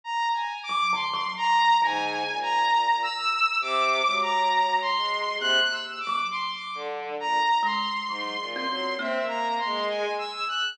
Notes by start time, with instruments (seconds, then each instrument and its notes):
0.04 lead 2 (sawtooth) A#5
0.34 lead 2 (sawtooth) G#5
0.63 lead 2 (sawtooth) D6
0.69 kalimba F#3
0.93 kalimba D3, lead 2 (sawtooth) C6
1.14 kalimba F#3
1.37 lead 2 (sawtooth) A#5
1.82 violin G#2, kalimba D3, lead 2 (sawtooth) G#5
2.27 violin A#2
2.42 lead 2 (sawtooth) A#5
3.03 lead 2 (sawtooth) E6
3.61 violin C3, lead 2 (sawtooth) D6
4.05 violin F#3, kalimba G#3
4.22 lead 2 (sawtooth) A#5
4.81 lead 2 (sawtooth) C6
4.96 violin G#3
5.39 violin C3, kalimba A#3, lead 2 (sawtooth) F#6
5.71 lead 2 (sawtooth) E6
6.00 lead 2 (sawtooth) D6
6.07 kalimba F#3
6.31 lead 2 (sawtooth) C6
6.53 lead 2 (sawtooth) D6
6.75 violin D3
7.20 violin A#2, lead 2 (sawtooth) A#5
7.63 kalimba G#3, lead 2 (sawtooth) C6
8.09 violin G#2, kalimba F#3
8.40 violin A#2
8.54 kalimba C4, lead 2 (sawtooth) C6
8.68 violin F#3
8.99 kalimba A#3, violin C4, lead 2 (sawtooth) E5
9.21 violin A#3
9.28 lead 2 (sawtooth) A#5
9.58 lead 2 (sawtooth) C6
9.65 violin G#3
9.89 lead 2 (sawtooth) G#5
10.18 lead 2 (sawtooth) E6
10.48 lead 2 (sawtooth) F#6